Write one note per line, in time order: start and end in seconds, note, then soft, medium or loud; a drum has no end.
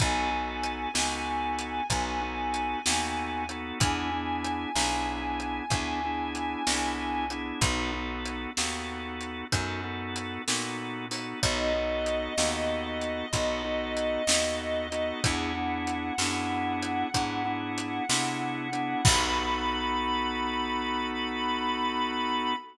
0.00 0.87 B1 loud
0.00 0.30 B3 medium
0.00 0.30 D#4 medium
0.00 0.30 F#4 medium
0.00 0.30 A4 medium
0.00 3.50 G#5 medium
0.00 kick medium
0.00 closed hi-hat medium
0.31 0.89 B3 medium
0.31 0.89 D#4 medium
0.31 0.89 F#4 medium
0.31 0.89 A4 medium
0.63 closed hi-hat medium
0.94 1.81 C#2 medium
0.94 1.82 B3 medium
0.94 1.82 D#4 medium
0.94 1.82 F#4 medium
0.94 1.82 A4 medium
0.94 snare medium
1.59 closed hi-hat medium
1.90 2.76 B1 loud
1.90 2.20 B3 medium
1.90 2.20 D#4 medium
1.90 2.20 F#4 medium
1.90 2.20 A4 medium
1.90 kick medium
1.90 closed hi-hat medium
2.21 2.80 B3 medium
2.21 2.80 D#4 medium
2.21 2.80 F#4 medium
2.21 2.80 A4 medium
2.54 closed hi-hat medium
2.86 3.73 D#2 medium
2.86 3.44 B3 medium
2.86 3.44 D#4 medium
2.86 3.44 F#4 medium
2.86 3.44 A4 medium
2.86 snare medium
3.49 3.79 B3 medium
3.49 3.79 D#4 medium
3.49 3.79 F#4 medium
3.49 3.79 A4 medium
3.49 closed hi-hat medium
3.80 4.66 E2 loud
3.80 4.10 B3 medium
3.80 4.10 D4 medium
3.80 4.10 E4 medium
3.80 4.10 G#4 medium
3.80 7.26 G#5 medium
3.80 kick medium
3.80 closed hi-hat medium
4.12 4.70 B3 medium
4.12 4.70 D4 medium
4.12 4.70 E4 medium
4.12 4.70 G#4 medium
4.44 closed hi-hat medium
4.75 5.61 B1 loud
4.75 5.64 B3 medium
4.75 5.64 D4 medium
4.75 5.64 E4 medium
4.75 5.64 G#4 medium
4.75 snare medium
5.40 closed hi-hat medium
5.70 6.56 D2 medium
5.70 6.00 B3 medium
5.70 6.00 D4 medium
5.70 6.00 E4 medium
5.70 6.00 G#4 medium
5.70 kick medium
5.70 closed hi-hat medium
6.04 6.63 B3 medium
6.04 6.63 D4 medium
6.04 6.63 E4 medium
6.04 6.63 G#4 medium
6.35 closed hi-hat medium
6.67 7.53 C2 medium
6.67 7.25 B3 medium
6.67 7.25 D4 medium
6.67 7.25 E4 medium
6.67 7.25 G#4 medium
6.67 snare medium
7.30 7.60 B3 medium
7.30 7.60 D4 medium
7.30 7.60 E4 medium
7.30 7.60 G#4 medium
7.30 closed hi-hat medium
7.61 8.47 B1 loud
7.61 7.91 B3 medium
7.61 7.91 D#4 medium
7.61 7.91 F#4 loud
7.61 7.91 A4 medium
7.61 kick medium
7.61 closed hi-hat medium
7.92 8.51 B3 medium
7.92 8.51 D#4 medium
7.92 8.51 F#4 medium
7.92 8.51 A4 medium
8.26 closed hi-hat medium
8.57 9.44 D#2 loud
8.57 9.45 B3 medium
8.57 9.45 D#4 medium
8.57 9.45 F#4 medium
8.57 9.45 A4 medium
8.57 snare medium
9.21 closed hi-hat medium
9.52 10.38 F#2 loud
9.52 9.81 B3 medium
9.52 9.81 D#4 medium
9.52 9.81 F#4 medium
9.52 9.81 A4 medium
9.52 kick medium
9.52 closed hi-hat medium
9.84 10.42 B3 medium
9.84 10.42 D#4 medium
9.84 10.42 F#4 medium
9.84 10.42 A4 medium
10.16 closed hi-hat medium
10.47 11.34 A#2 medium
10.47 11.06 B3 medium
10.47 11.06 D#4 medium
10.47 11.06 F#4 medium
10.47 11.06 A4 medium
10.47 snare medium
11.11 11.40 B3 medium
11.11 11.40 D#4 medium
11.11 11.40 F#4 medium
11.11 11.40 A4 medium
11.11 open hi-hat medium
11.43 12.29 B1 loud
11.43 11.73 B3 medium
11.43 11.73 D#4 medium
11.43 11.73 F#4 medium
11.43 11.73 A4 medium
11.43 15.23 D#5 medium
11.43 kick medium
11.43 closed hi-hat medium
11.75 12.34 B3 medium
11.75 12.34 D#4 medium
11.75 12.34 F#4 medium
11.75 12.34 A4 medium
12.06 closed hi-hat medium
12.38 13.23 D#2 loud
12.38 13.26 B3 medium
12.38 13.26 D#4 medium
12.38 13.26 F#4 medium
12.38 13.26 A4 medium
12.38 snare medium
13.01 closed hi-hat medium
13.33 14.18 B1 loud
13.33 13.62 B3 medium
13.33 13.62 D#4 medium
13.33 13.62 F#4 medium
13.33 13.62 A4 medium
13.33 kick medium
13.33 closed hi-hat medium
13.64 14.23 B3 medium
13.64 14.23 D#4 medium
13.64 14.23 F#4 medium
13.64 14.23 A4 medium
13.97 closed hi-hat medium
14.27 15.13 D#2 loud
14.27 14.87 B3 medium
14.27 14.87 D#4 medium
14.27 14.87 F#4 medium
14.27 14.87 A4 medium
14.27 snare loud
14.92 15.21 B3 medium
14.92 15.21 D#4 medium
14.92 15.21 F#4 medium
14.92 15.21 A4 medium
14.92 closed hi-hat medium
15.24 16.11 E2 loud
15.24 15.53 B3 medium
15.24 15.53 D4 medium
15.24 15.53 E4 medium
15.24 15.53 G#4 loud
15.24 19.03 F#5 medium
15.24 kick medium
15.24 closed hi-hat medium
15.55 16.13 B3 medium
15.55 16.13 D4 medium
15.55 16.13 E4 medium
15.55 16.13 G#4 medium
15.87 closed hi-hat medium
16.18 17.04 F#2 loud
16.18 17.08 B3 medium
16.18 17.08 D4 medium
16.18 17.08 E4 medium
16.18 17.08 G#4 medium
16.18 snare medium
16.83 closed hi-hat medium
17.14 18.00 G#2 medium
17.14 17.43 B3 medium
17.14 17.43 D4 medium
17.14 17.43 E4 medium
17.14 17.43 G#4 medium
17.14 kick medium
17.14 closed hi-hat medium
17.45 18.04 B3 medium
17.45 18.04 D4 medium
17.45 18.04 E4 medium
17.45 18.04 G#4 medium
17.78 closed hi-hat medium
18.09 18.95 C3 loud
18.09 18.68 B3 medium
18.09 18.68 D4 medium
18.09 18.68 E4 medium
18.09 18.68 G#4 medium
18.09 snare medium
18.72 19.01 B3 medium
18.72 19.01 D4 medium
18.72 19.01 E4 medium
18.72 19.01 G#4 medium
18.72 closed hi-hat medium
19.04 22.54 B1 loud
19.04 22.54 B3 loud
19.04 22.54 D#4 loud
19.04 22.54 F#4 loud
19.04 22.54 A4 loud
19.04 22.54 B5 loud
19.04 kick loud
19.04 crash loud